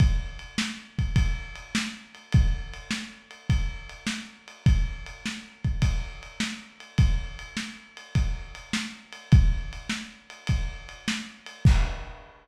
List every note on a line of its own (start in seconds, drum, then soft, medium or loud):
0.00 kick loud
0.00 ride medium
0.39 ride medium
0.58 snare loud
0.99 kick medium
0.99 ride medium
1.16 kick medium
1.16 ride loud
1.56 ride medium
1.75 snare loud
2.15 ride medium
2.33 kick loud
2.33 ride medium
2.74 ride medium
2.91 snare loud
3.31 ride medium
3.50 kick medium
3.50 ride medium
3.89 ride medium
4.07 snare loud
4.48 ride medium
4.66 kick loud
4.66 ride medium
5.06 ride medium
5.26 snare medium
5.64 kick medium
5.64 ride medium
5.82 kick medium
5.82 ride loud
6.23 ride medium
6.40 snare loud
6.80 ride medium
6.98 kick loud
6.98 ride loud
7.39 ride medium
7.57 snare medium
7.97 ride medium
8.15 kick medium
8.15 ride medium
8.55 ride medium
8.73 snare loud
9.12 ride medium
9.32 kick loud
9.32 ride medium
9.73 ride medium
9.89 snare medium
10.30 ride medium
10.47 kick medium
10.47 ride loud
10.89 ride medium
11.08 snare loud
11.46 ride medium
11.65 kick loud
11.65 crash loud